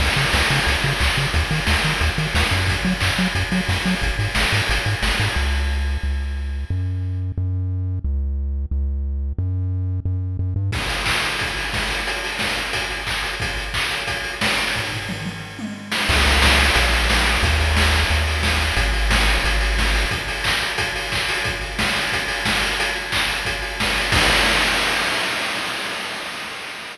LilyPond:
<<
  \new Staff \with { instrumentName = "Synth Bass 1" } { \clef bass \time 4/4 \key des \major \tempo 4 = 179 des,8 des8 des,8 des8 des,8 des8 des,8 des8 | ees,8 ees8 ees,8 ees8 ees,8 ees8 ees,8 ges,8~ | ges,8 ges8 ges,8 ges8 ges,8 ges8 ges,8 ges8 | aes,,8 aes,8 aes,,8 aes,8 aes,,8 aes,8 aes,,8 aes,8 |
des,2 des,2 | ges,2 ges,2 | des,2 des,2 | ges,2 ges,4 ges,8 g,8 |
\key aes \major r1 | r1 | r1 | r1 |
\key des \major des,2 bes,,2 | ees,2 ees,2 | aes,,2 aes,,2 | r1 |
r1 | r1 | r1 | }
  \new DrumStaff \with { instrumentName = "Drums" } \drummode { \time 4/4 <cymc bd>8 hho8 <bd sn>8 hho8 <hh bd>8 hho8 <hc bd>8 hho8 | <hh bd>8 hho8 <bd sn>8 hho8 <hh bd>8 hho8 <bd sn>8 hho8 | <hh bd>8 hho8 <hc bd>8 hho8 <hh bd>8 hho8 <bd sn>8 hho8 | <hh bd>8 hho8 <bd sn>8 hho8 <hh bd>8 hho8 <bd sn>8 hho8 |
r4 r4 r4 r4 | r4 r4 r4 r4 | r4 r4 r4 r4 | r4 r4 r4 r4 |
<cymc bd>16 hh16 hho16 hh16 <hc bd>16 hh16 hho16 hh16 <hh bd>16 hh16 hho16 hh16 <bd sn>16 hh16 hho16 hh16 | hh16 hh16 hho16 hh16 <bd sn>16 hh16 hho16 hh16 <hh bd>16 hh16 hho16 hh16 <hc bd>16 hh16 hho16 hh16 | <hh bd>16 hh16 hho16 hh16 <hc bd>16 hh16 hho16 hh16 <hh bd>16 hh16 hho16 hh16 <bd sn>16 hh16 hho16 hho16 | <bd tomfh>8 tomfh8 toml8 toml8 r8 tommh8 r8 sn8 |
<cymc bd>8 hho8 <bd sn>8 hho8 <hh bd>8 hho8 <bd sn>8 hho8 | <hh bd>8 hho8 <bd sn>8 hho8 <hh bd>8 hho8 <bd sn>8 hho8 | <hh bd>8 hho8 <bd sn>8 hho8 <hh bd>8 hho8 <bd sn>8 hho8 | <hh bd>8 hho8 <hc bd>8 hho8 <hh bd>8 hho8 <hc bd>8 hho8 |
<hh bd>8 hho8 <bd sn>8 hho8 <hh bd>8 hho8 <bd sn>8 hho8 | hh8 hho8 <hc bd>8 hho8 <hh bd>8 hho8 <bd sn>8 hho8 | <cymc bd>4 r4 r4 r4 | }
>>